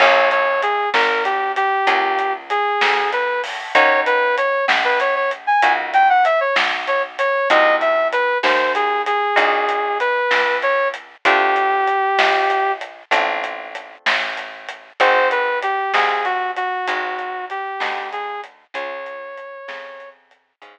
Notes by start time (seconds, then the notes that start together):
0.00 A#1 A#3 C#4 F4 G#4 C#5, kick, crash
0.31 C#5, closed hi-hat
0.62 G#4, closed hi-hat
0.94 G#1 A#4, snare
1.25 G4, closed hi-hat
1.56 G4, closed hi-hat
1.87 C#2 A#3 C#4 F4 G#4, kick, closed hi-hat
2.19 closed hi-hat
2.50 G#4, closed hi-hat
2.81 D2, snare
3.12 B4, closed hi-hat
3.44 open hi-hat
3.75 D#2 A#3 C#4 D#4 F#4 C#5, kick, closed hi-hat
4.06 B4, closed hi-hat
4.37 C#5, closed hi-hat
4.68 A#1, snare
4.84 B4
5.00 C#5, closed hi-hat
5.16 C#5
5.31 closed hi-hat
5.47 G#5
5.62 C#2 A#3 C#4 D#4 F#4, closed hi-hat
5.94 G5, closed hi-hat
6.10 F#5
6.25 E5, closed hi-hat
6.40 C#5
6.56 B1, snare
6.87 C#5, closed hi-hat
7.19 C#5, closed hi-hat
7.50 C2 A#3 C4 D#4 F#4 D#5, kick, closed hi-hat
7.81 E5, closed hi-hat
8.12 B4, closed hi-hat
8.43 D#2 C5, snare
8.75 G#4, closed hi-hat
9.06 G#4, closed hi-hat
9.36 A#1 A#3 C4 D#4 F#4, kick, closed hi-hat
9.69 closed hi-hat
10.00 B4, closed hi-hat
10.31 C#2, snare
10.62 C#5, closed hi-hat
10.94 closed hi-hat
11.25 D2 A3 C4 D4 F4 G4, kick, closed hi-hat
11.56 closed hi-hat
11.88 closed hi-hat
12.18 A#1, snare
12.50 closed hi-hat
12.81 closed hi-hat
13.11 A1 A3 C4 D4 F4, kick, closed hi-hat
13.44 closed hi-hat
13.75 closed hi-hat
14.06 A1, snare
14.37 closed hi-hat
14.69 closed hi-hat
15.00 G#1 C4 D#4 F#4 G#4 C5, kick, closed hi-hat
15.31 B4, closed hi-hat
15.62 G4, closed hi-hat
15.94 C2 C4 D#4 F#4 G#4, snare
16.25 F#4, closed hi-hat
16.56 F#4, closed hi-hat
16.88 G#1 C4 D#4 F#4 G#4, kick, closed hi-hat
17.19 closed hi-hat
17.50 G4, closed hi-hat
17.80 D2 C4 D#4 F#4 G#4, snare
18.12 G#4, closed hi-hat
18.44 closed hi-hat
18.74 C#2 C#4 F4 G#4 C#5, kick, closed hi-hat
19.06 closed hi-hat
19.38 closed hi-hat
19.68 F2 C#4 F4 G#4, snare
20.00 closed hi-hat
20.31 closed hi-hat
20.62 G#2 C#4 F4 G#4, kick, closed hi-hat